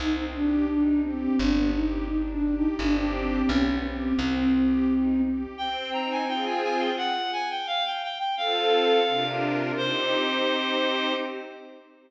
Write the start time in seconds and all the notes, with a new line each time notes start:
0.00 C2 C4 D#4
0.35 D4 G4
0.69 D4 D#4
1.03 C4 G4
1.39 G1 B3 D4
1.74 D#4 G4
2.08 D4 D#4
2.32 D4
2.44 G4
2.56 D#4
2.79 G1 C4 D4 G4
3.14 C4
3.49 B1 B3 C#4
3.83 C4 G4
4.18 C2 C4
4.55 G4
4.89 D#4
5.24 G4
5.57 C4 G5
5.92 D#4 A#5
6.11 G#5
6.27 C4 F4 G#4 G5
6.45 G#5
6.63 G#5
6.79 G5
6.97 F#5
7.33 G#5
7.50 G5
7.67 F5
7.85 G5
8.03 G5
8.18 G5
8.37 C4 F4 A4 F5
9.08 C3 D4 F4 A#4
9.77 C4 D#4 G4 C5